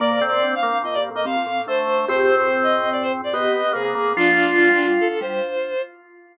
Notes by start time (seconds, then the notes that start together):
0.00 A#2 A#3 D5
0.11 C3
0.21 A2 C4
0.28 D5
0.32 A#2
0.43 D2
0.55 F5
0.63 A#3
0.73 D2
0.84 F2 A#3 D#5
0.94 G2 D5
1.11 A2
1.15 A#3 D#5
1.25 G2 C4 F5
1.36 F2
1.46 A2
1.67 D2 A3 C5
1.87 D2
1.98 D2
2.08 F2 G#2 C4 G4 C5
2.37 C5
2.63 D#5
2.92 D5
3.02 C5
3.24 D5
3.33 B3 G4 D#5
3.73 C3 A#3 G#4
3.85 A#3
3.95 G#2 A#3
4.17 A#1 D2 F3 D4 F4
4.58 D2 F3
4.69 D2 G3
4.79 D2
5.00 A4
5.21 G3 C5